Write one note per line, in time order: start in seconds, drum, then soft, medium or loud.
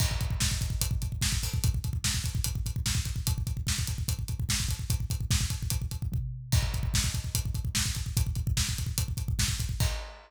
0.00 kick loud
0.00 crash loud
0.11 kick medium
0.21 kick medium
0.21 closed hi-hat medium
0.30 kick medium
0.40 kick medium
0.40 snare loud
0.51 kick medium
0.61 kick medium
0.61 closed hi-hat medium
0.70 kick medium
0.81 kick medium
0.81 closed hi-hat loud
0.91 kick medium
1.02 kick medium
1.02 closed hi-hat medium
1.12 kick medium
1.21 kick medium
1.21 snare loud
1.32 kick medium
1.43 kick medium
1.43 open hi-hat medium
1.54 kick medium
1.64 kick loud
1.64 closed hi-hat loud
1.74 kick medium
1.84 kick medium
1.84 closed hi-hat medium
1.93 kick medium
2.04 kick medium
2.04 snare loud
2.14 kick medium
2.24 kick medium
2.24 closed hi-hat medium
2.35 kick medium
2.44 kick medium
2.44 closed hi-hat loud
2.55 kick medium
2.66 kick medium
2.66 closed hi-hat medium
2.76 kick medium
2.86 kick medium
2.86 snare loud
2.95 kick medium
3.05 kick medium
3.05 closed hi-hat medium
3.16 kick medium
3.27 kick loud
3.27 closed hi-hat loud
3.38 kick medium
3.47 kick medium
3.47 closed hi-hat medium
3.57 kick medium
3.67 kick medium
3.67 snare loud
3.79 kick medium
3.87 kick medium
3.87 closed hi-hat medium
3.98 kick medium
4.08 kick medium
4.08 closed hi-hat loud
4.19 kick medium
4.28 kick medium
4.28 closed hi-hat medium
4.40 kick medium
4.49 kick medium
4.49 snare loud
4.60 kick medium
4.69 kick medium
4.69 closed hi-hat medium
4.79 kick medium
4.90 kick loud
4.90 closed hi-hat loud
5.00 kick medium
5.10 kick medium
5.10 closed hi-hat medium
5.20 kick medium
5.31 kick loud
5.31 snare loud
5.41 kick medium
5.50 kick medium
5.50 closed hi-hat medium
5.62 kick medium
5.70 kick medium
5.70 closed hi-hat loud
5.82 kick medium
5.91 kick medium
5.91 closed hi-hat medium
6.02 kick medium
6.12 kick medium
6.12 floor tom medium
6.52 kick loud
6.52 crash loud
6.62 kick medium
6.74 kick medium
6.74 closed hi-hat medium
6.83 kick medium
6.94 kick loud
6.94 snare loud
7.04 kick medium
7.14 kick medium
7.14 closed hi-hat medium
7.24 kick medium
7.35 kick medium
7.35 closed hi-hat loud
7.45 kick medium
7.55 kick medium
7.55 closed hi-hat medium
7.65 kick medium
7.75 kick medium
7.75 snare loud
7.86 kick medium
7.95 kick medium
7.95 closed hi-hat medium
8.06 kick medium
8.17 kick loud
8.17 closed hi-hat loud
8.27 kick medium
8.35 kick medium
8.35 closed hi-hat medium
8.47 kick loud
8.57 kick medium
8.57 snare loud
8.69 kick medium
8.78 kick medium
8.78 closed hi-hat medium
8.86 kick medium
8.98 kick medium
8.98 closed hi-hat loud
9.08 kick medium
9.17 kick medium
9.17 closed hi-hat medium
9.28 kick medium
9.39 kick medium
9.39 snare loud
9.48 kick medium
9.60 kick medium
9.60 closed hi-hat medium
9.69 kick medium
9.80 kick loud
9.80 crash loud